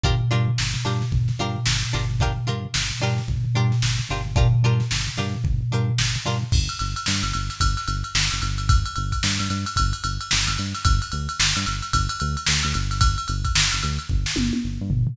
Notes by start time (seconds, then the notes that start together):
0.03 G1 D4 F4 G4 A#4, kick, floor tom
0.21 floor tom
0.31 G2 D4 F4 G4 A#4, floor tom
0.48 floor tom
0.58 G1, snare
0.74 floor tom
0.85 G2 D4 F4 G4 A#4, floor tom
1.02 snare, floor tom
1.12 G1, kick, floor tom
1.28 snare, floor tom
1.39 G2 D4 F4 G4 A#4, floor tom
1.55 floor tom
1.66 G1, snare
1.82 floor tom
1.93 G1 D4 F4 G4 A#4, floor tom
2.10 floor tom
2.20 D4 F4 G4 A#4, kick, floor tom
2.36 floor tom
2.47 G2 D4 F4 G4 A#4, floor tom
2.64 floor tom
2.74 G1, snare
2.91 floor tom
3.01 G2 D4 F4 G4 A#4, floor tom
3.18 snare, floor tom
3.28 G1, kick, floor tom
3.45 floor tom
3.55 G2 D4 F4 G4 A#4, floor tom
3.71 snare, floor tom
3.82 G1, snare
3.99 floor tom
4.09 G1 D4 F4 G4 A#4, floor tom
4.26 floor tom
4.36 D4 F4 G4 A#4, kick, floor tom
4.53 floor tom
4.63 G2 D4 F4 G4 A#4, floor tom
4.80 snare, floor tom
4.91 G1, snare
5.06 snare, floor tom
5.17 G2 D4 F4 G4 A#4, floor tom
5.34 floor tom
5.44 G1, kick, floor tom
5.61 floor tom
5.72 G2 D4 F4 G4 A#4, floor tom
5.88 floor tom
5.98 G1, snare
6.16 floor tom
6.25 G2 D4 F4 G4 A#4, floor tom
6.42 floor tom
6.52 G1, kick, crash
6.69 ride
6.79 G1, snare, ride
6.96 ride
7.06 G2, snare
7.23 G1, ride
7.33 G1, ride
7.50 snare, ride
7.60 G1, kick, ride
7.77 snare, ride
7.88 G1, ride
8.04 ride
8.15 G1, snare
8.31 G1, ride
8.42 G1, ride
8.58 ride
8.69 kick, ride
8.85 ride
8.96 G1, ride
9.12 kick, ride
9.23 G2, snare
9.39 G2, ride
9.50 G2, ride
9.66 ride
9.76 G1, kick, ride
9.93 ride
10.04 G1, ride
10.21 ride
10.31 G1, snare
10.47 G1, ride
10.58 G2, ride
10.75 snare, ride
10.85 G1, kick, ride
11.02 ride
11.12 D2, ride
11.29 ride
11.39 G1, snare
11.56 G2, ride
11.66 G1, ride
11.82 ride
11.93 G1, kick, ride
12.09 ride
12.20 D2, ride
12.37 ride
12.47 D2, snare
12.63 D2, ride
12.74 G1, ride
12.91 snare, ride
13.01 kick, ride
13.18 ride
13.28 G1, ride
13.44 kick, ride
13.55 G1, snare
13.72 G1, ride
13.83 D2, ride
13.99 ride
14.09 G1, kick
14.26 snare
14.36 G1, high tom
14.53 high tom
14.64 G1
14.81 G2
14.90 G1, floor tom
15.07 floor tom